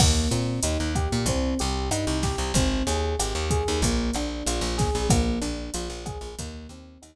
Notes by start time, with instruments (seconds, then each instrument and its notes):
0.00 electric bass (finger) D#2, electric piano 1 A#3, kick, cross-stick, crash
0.31 electric bass (finger) A#2, electric piano 1 C4, closed hi-hat
0.63 electric bass (finger) D#2, electric piano 1 D#4, closed hi-hat
0.80 electric bass (finger) D#2
0.95 electric piano 1 G4, kick, cross-stick, closed hi-hat
1.12 electric bass (finger) A#2
1.26 electric bass (finger) C2, electric piano 1 C4, kick, closed hi-hat
1.59 electric bass (finger) C2, electric piano 1 G4, closed hi-hat
1.91 electric bass (finger) G2, electric piano 1 D#4, cross-stick, closed hi-hat
2.07 electric bass (finger) C2
2.23 electric piano 1 G4, kick, snare, closed hi-hat
2.38 electric bass (finger) C2
2.54 electric bass (finger) G#1, electric piano 1 C4, kick, closed hi-hat
2.87 electric bass (finger) D#2, electric piano 1 G#4, closed hi-hat
3.19 electric bass (finger) G#1, electric piano 1 G4, cross-stick, closed hi-hat
3.35 electric bass (finger) D#2
3.51 electric piano 1 G#4, kick, closed hi-hat
3.68 electric bass (finger) D#2
3.82 electric bass (finger) A#1, electric piano 1 A#3, kick, closed hi-hat
4.14 electric bass (finger) A#1, electric piano 1 D4, cross-stick, closed hi-hat
4.46 electric bass (finger) A#1, electric piano 1 F4, closed hi-hat
4.61 electric bass (finger) A#1
4.78 electric piano 1 G#4, kick, snare, closed hi-hat
4.95 electric bass (finger) A#1
5.10 electric bass (finger) A#1, electric piano 1 A#3, kick, cross-stick, closed hi-hat
5.41 electric bass (finger) A#1, electric piano 1 D4, closed hi-hat
5.74 electric bass (finger) A#1, electric piano 1 F4, closed hi-hat
5.90 electric bass (finger) A#1
6.06 electric piano 1 G#4, kick, cross-stick, closed hi-hat
6.21 electric bass (finger) A#1
6.39 electric bass (finger) D#2, electric piano 1 A#3, kick, closed hi-hat
6.69 electric bass (finger) D#2, electric piano 1 C4, closed hi-hat
7.02 electric bass (finger) D#2, electric piano 1 D#4, cross-stick, closed hi-hat